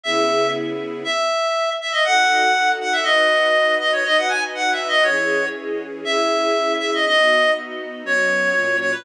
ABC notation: X:1
M:2/4
L:1/16
Q:1/4=120
K:C#m
V:1 name="Clarinet"
e4 z4 | e6 e d | f6 f e | d6 d c |
d f g z (3f2 e2 d2 | c4 z4 | e6 e d | d4 z4 |
c6 c B |]
V:2 name="String Ensemble 1"
[C,B,EG]8 | z8 | [DFA]8 | [DFB]8 |
[DFB]8 | [E,CG]8 | [CEG]8 | [B,DF]8 |
[F,B,C]4 [^A,,F,C]4 |]